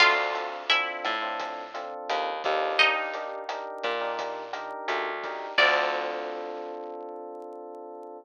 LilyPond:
<<
  \new Staff \with { instrumentName = "Acoustic Guitar (steel)" } { \time 4/4 \key d \minor \tempo 4 = 86 <f' f''>4 <e' e''>2 r4 | <ees' ees''>2~ <ees' ees''>8 r4. | d''1 | }
  \new Staff \with { instrumentName = "Electric Piano 1" } { \time 4/4 \key d \minor <c' d' f' a'>16 <c' d' f' a'>16 <c' d' f' a'>8 <c' d' f' a'>8. <c' d' f' a'>8. <c' d' f' a'>4 <c' d' f' a'>8 | <d' ees' g' bes'>16 <d' ees' g' bes'>16 <d' ees' g' bes'>8 <d' ees' g' bes'>8. <d' ees' g' bes'>8. <d' ees' g' bes'>4 <d' ees' g' bes'>8 | <c' d' f' a'>1 | }
  \new Staff \with { instrumentName = "Electric Bass (finger)" } { \clef bass \time 4/4 \key d \minor d,4. a,4. ees,8 ees,8~ | ees,4. bes,4. d,4 | d,1 | }
  \new DrumStaff \with { instrumentName = "Drums" } \drummode { \time 4/4 <cymc bd ss>8 hh8 hh8 <hh bd ss>8 <hh bd>8 hh8 <hh ss>8 <hh bd>8 | <hh bd>8 hh8 <hh ss>8 <hh bd>8 <hh bd>8 <hh ss>8 hh8 <hh bd>8 | <cymc bd>4 r4 r4 r4 | }
>>